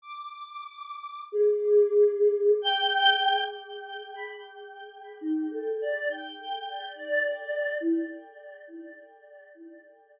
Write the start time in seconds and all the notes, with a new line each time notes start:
0.02 D6
1.32 G#4
2.62 G5
4.14 B5
5.21 D#4
5.51 A4
5.81 D5
6.10 G5
6.96 D5
7.80 E4